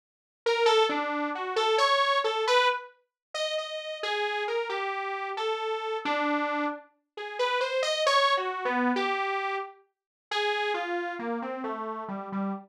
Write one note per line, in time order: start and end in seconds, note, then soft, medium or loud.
0.46 0.66 A#4 medium
0.66 0.86 A4 loud
0.89 1.30 D4 medium
1.35 1.55 F#4 medium
1.56 1.76 A4 loud
1.78 2.18 C#5 loud
2.24 2.44 A4 medium
2.47 2.68 B4 loud
3.34 3.54 D#5 medium
3.58 3.98 D#5 medium
4.03 4.43 G#4 loud
4.48 4.68 A#4 medium
4.69 5.30 G4 medium
5.37 5.97 A4 medium
6.05 6.66 D4 loud
7.17 7.37 G#4 medium
7.39 7.59 B4 medium
7.61 7.81 C5 medium
7.82 8.03 D#5 medium
8.07 8.33 C#5 loud
8.37 8.64 F#4 medium
8.65 8.92 B3 medium
8.96 9.56 G4 medium
10.31 10.72 G#4 loud
10.74 11.14 F4 medium
11.19 11.39 A#3 medium
11.42 11.62 C4 medium
11.64 12.04 A3 medium
12.08 12.29 G3 medium
12.32 12.52 G3 medium